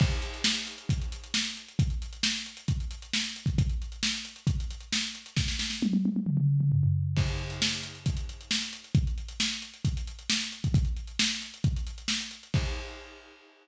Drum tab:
CC |x---------------|----------------|----------------|----------------|
HH |-xxx-xxxxxxx-xxx|xxxx-xxxxxxx-xxx|xxxx-xxxxxxx-xxx|----------------|
SD |----o-------o---|----o-------o---|----o-------o---|oooo------------|
T1 |----------------|----------------|----------------|----oooo--------|
T2 |----------------|----------------|----------------|--------oo-o----|
FT |----------------|----------------|----------------|------------oo--|
BD |o-------o-------|o-------o------o|o-------o-------|o---------------|

CC |x---------------|----------------|----------------|x---------------|
HH |-xxx-xxxxxxx-xxx|xxxx-xxxxxxx-xxx|xxxx-xxxxxxx-xxx|----------------|
SD |----o-------o---|----o-------o---|----o-------o---|----------------|
T1 |----------------|----------------|----------------|----------------|
T2 |----------------|----------------|----------------|----------------|
FT |----------------|----------------|----------------|----------------|
BD |o-------o-------|o-------o------o|o-------o-------|o---------------|